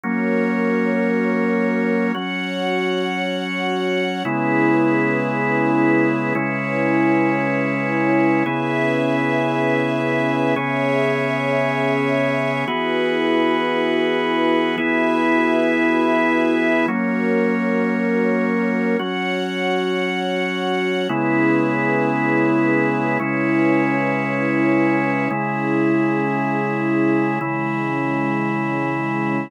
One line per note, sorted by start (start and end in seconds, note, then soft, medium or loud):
0.04 2.12 F#3 medium
0.04 2.12 A#3 medium
0.04 2.12 C#4 medium
0.04 2.13 F#4 medium
0.04 2.13 A#4 loud
0.04 2.13 C#5 medium
2.15 4.23 F#3 medium
2.15 4.23 C#4 medium
2.15 4.23 F#4 medium
2.15 4.23 C#5 medium
2.15 4.23 F#5 medium
4.25 6.33 C#3 medium
4.25 6.33 G#3 medium
4.25 6.33 B3 medium
4.25 6.34 C#4 medium
4.25 6.33 E4 medium
4.25 6.34 E4 medium
4.25 6.34 G#4 loud
4.25 6.34 B4 medium
6.35 8.43 C#3 medium
6.35 8.43 G#3 medium
6.35 8.43 C#4 medium
6.35 8.44 C#4 medium
6.35 8.43 E4 medium
6.35 8.44 E4 loud
6.35 8.44 B4 medium
6.35 8.44 C#5 medium
8.46 10.54 C#3 medium
8.46 10.54 B3 medium
8.46 10.54 C#4 loud
8.46 10.54 E4 medium
8.46 10.54 G#4 medium
8.46 10.54 B4 loud
8.46 10.54 E5 medium
10.56 12.65 C#3 medium
10.56 12.65 B3 medium
10.56 12.65 C#4 medium
10.56 12.65 G#4 medium
10.56 12.65 G#4 loud
10.56 12.65 C#5 loud
10.56 12.65 E5 loud
12.67 14.76 E3 medium
12.67 14.76 B3 medium
12.67 14.76 E4 loud
12.67 14.76 F#4 loud
12.67 14.76 F#4 medium
12.67 14.76 G#4 medium
12.67 14.76 B4 loud
14.78 16.86 E3 medium
14.78 16.86 B3 medium
14.78 16.86 E4 medium
14.78 16.86 F#4 medium
14.78 16.86 G#4 medium
14.78 16.86 B4 medium
14.78 16.86 E5 medium
16.88 18.96 F#3 medium
16.88 18.96 A#3 medium
16.88 18.96 C#4 medium
16.88 18.97 F#4 medium
16.88 18.97 A#4 loud
16.88 18.97 C#5 medium
18.99 21.08 F#3 medium
18.99 21.08 C#4 medium
18.99 21.07 F#4 medium
18.99 21.08 F#4 medium
18.99 21.07 C#5 medium
18.99 21.07 F#5 medium
21.09 23.18 C#3 medium
21.09 23.18 G#3 medium
21.09 23.18 B3 medium
21.09 23.18 C#4 medium
21.09 23.18 E4 medium
21.09 23.18 G#4 loud
21.09 23.18 B4 medium
23.20 25.28 C#3 medium
23.20 25.28 G#3 medium
23.20 25.28 C#4 medium
23.20 25.28 E4 medium
23.20 25.28 E4 loud
23.20 25.28 B4 medium
23.20 25.28 C#5 medium
25.30 27.39 C#3 medium
25.30 27.39 G#3 medium
25.30 27.39 C#4 medium
25.30 27.39 E4 loud
25.30 27.39 E4 medium
25.30 27.39 G#4 loud
27.41 29.49 C#3 medium
27.41 29.49 E3 medium
27.41 29.49 G#3 loud
27.41 29.49 C#4 medium
27.41 29.49 E4 medium
27.41 29.49 G#4 medium